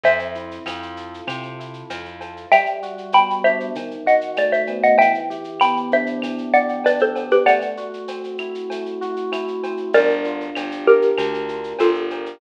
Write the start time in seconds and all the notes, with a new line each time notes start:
0.03 F2 C4 C5 E5, cowbell, shaker
0.19 shaker
0.35 E4, shaker
0.51 shaker
0.66 F2 F4, cowbell, claves, shaker
0.82 shaker
0.97 A4, shaker
1.14 shaker
1.27 C3 C4, cowbell, claves, shaker
1.43 shaker
1.59 E4, shaker
1.73 shaker
1.90 F2 F4, cowbell, shaker
2.05 shaker
2.21 A4, cowbell, shaker
2.37 shaker
2.52 G3 E5 G5, cowbell, claves, shaker
2.66 shaker
2.82 F#4, shaker
2.98 shaker
3.12 B3 G5 B5, cowbell, shaker
3.30 shaker
3.44 D4 C5 E5, claves, shaker
3.60 shaker
3.75 D#3, cowbell, shaker
3.91 shaker
4.06 F#4 D#5 F#5, shaker
4.21 shaker
4.36 A3 D5, cowbell, claves, shaker
4.52 C5 E5, shaker
4.67 B3, cowbell, shaker
4.83 D#5 F#5, shaker
4.98 E3 E5 G5, cowbell, shaker
5.14 shaker
5.30 G4, shaker
5.44 shaker
5.60 B3 G5 B5, cowbell, claves, shaker
5.77 shaker
5.92 D4 C5 E5, shaker
6.06 shaker
6.22 E3, cowbell, claves, shaker
6.38 shaker
6.53 G4 D5 F#5, shaker
6.69 shaker
6.84 D4 B4 D5, cowbell, shaker
6.99 A4 C5, shaker
7.15 B3, cowbell, shaker
7.31 G4 B4, shaker
7.46 A3 D5 F#5, cowbell, claves, shaker
7.61 shaker
7.77 F#4, shaker
7.94 shaker
8.08 C4, cowbell, shaker
8.24 shaker
8.38 E4, claves, shaker
8.55 shaker
8.70 A3, cowbell, shaker
8.86 shaker
9.01 F#4, shaker
9.16 shaker
9.32 E4, cowbell, claves, shaker
9.48 shaker
9.63 C4, cowbell, shaker
9.77 shaker
9.93 G1 D4 A#4 D5, cowbell, shaker
10.10 shaker
10.24 F4, shaker
10.41 shaker
10.55 G1 G4, cowbell, claves, shaker
10.72 shaker
10.87 G4 A#4, shaker
11.02 shaker
11.18 D2 D4, cowbell, claves, shaker
11.34 shaker
11.49 F4, shaker
11.64 shaker
11.79 G1 F4 G4 A4, cowbell, shaker
11.94 shaker
12.10 A#4, cowbell, shaker
12.26 shaker